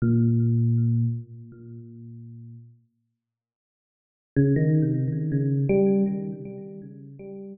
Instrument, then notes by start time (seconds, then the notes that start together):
electric piano 1
0.02 A#2
4.36 C#3
4.56 D#3
4.82 C3
5.08 D#3
5.32 C#3
5.69 G3